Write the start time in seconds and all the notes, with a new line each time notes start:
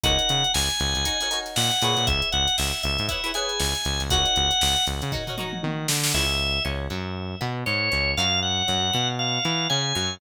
0.03 C#2 D#4 F#4 A#4 C#5 F#5, kick, closed hi-hat
0.19 closed hi-hat
0.29 C#3, snare, closed hi-hat
0.44 closed hi-hat
0.54 C#2 G#5, snare
0.70 closed hi-hat
0.80 C#2, closed hi-hat
0.95 C#2, closed hi-hat
1.05 D#4 F#4 A#4 C#5, kick, closed hi-hat
1.20 D#4 F#4 A#4 C#5, closed hi-hat
1.31 D#4 F#4 A#4 C#5, closed hi-hat
1.46 snare, closed hi-hat
1.56 A#2 F#5, snare
1.71 closed hi-hat
1.82 A#2 E4 G#4 B4 C#5, closed hi-hat
1.97 A#2, closed hi-hat
2.07 C#2 E5, kick, closed hi-hat
2.22 closed hi-hat
2.32 C#2 F#5, closed hi-hat
2.47 snare, closed hi-hat
2.58 C#2 E5, snare
2.73 closed hi-hat
2.83 C#2 E5, closed hi-hat
2.98 G#2, closed hi-hat
3.08 E4 G#4 B4 C#5 E5, kick, closed hi-hat
3.24 E4 G#4 B4 C#5, closed hi-hat
3.34 E4 G#4 B4 C#5 G#5, closed hi-hat
3.49 closed hi-hat
3.60 C#2, snare
3.75 closed hi-hat
3.85 C#2, snare, closed hi-hat
4.00 C#2, closed hi-hat
4.10 C#2 D#4 F#4 A#4 C#5 F#5, kick, closed hi-hat
4.25 closed hi-hat
4.36 C#2, closed hi-hat
4.51 closed hi-hat
4.61 C#2, snare
4.76 closed hi-hat
4.87 C#2, closed hi-hat
5.02 C#3, closed hi-hat
5.12 D#4 F#4 A#4 C#5, kick, floor tom
5.27 D#4 F#4 A#4 C#5, floor tom
5.38 D#4 F#4 A#4 C#5, mid tom
5.53 mid tom
5.63 D#3, high tom
5.88 D3, snare
6.03 snare
6.14 C#2 E4 G#4 B4 C#5 E5
6.65 C#2 C#4
6.90 F#2 F#3
7.41 B2 B3
7.66 G#2 G#3 C#5
7.92 C#2 C#4
8.17 F#2 F4 F#4 A#4 C#5 F5
8.42 F#5
8.68 F#2 F#3
8.93 B2 B3
9.19 F5
9.45 E3 E4
9.69 C#3 C#4 G#5
9.95 F#2 F#3